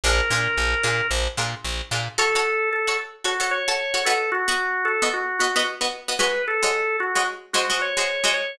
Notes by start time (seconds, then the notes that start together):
0.04 A#1 D4 F4 G#4 A#4
0.30 A#2 D4 F4 G#4 A#4
0.57 A#1
0.83 A#2 D4 F4 G#4 A#4
1.11 A#1
1.37 A#2 D4 F4 G#4 A#4
1.64 A#1
1.91 A#2 D4 F4 G#4 A#4
2.18 F#4 A4 C#5
2.35 F#4 A4 C#5
2.73 A4
2.87 F#4 A4 C#5
3.24 F#4 A4 C#5
3.40 F#4 A4 C#5
3.51 C#5
3.68 F#4 A4 C#5
3.94 F#4 A4 C#5
4.05 B3 F#4 A4 D#5
4.32 F#4
4.48 B3 F#4 D#5
4.85 A4
5.02 B3 F#4 D#5
5.14 F#4
5.39 B3 F#4 D#5
5.56 B3 F#4 D#5
5.81 B3 F#4 D#5
6.08 B3 F#4 D#5
6.19 G#3 F#4 B4 C#5 D#5
6.48 A4
6.62 G#3 F#4 C#5 D#5
7.00 F#4
7.15 G#3 F#4 C#5 D#5
7.53 G#3 F#4 C5 D#5
7.70 G#3 F#4 C5 D#5
7.82 C#5
7.97 G#3 F#4 C5 D#5
8.24 G#3 F#4 C5 D#5
8.34 C#5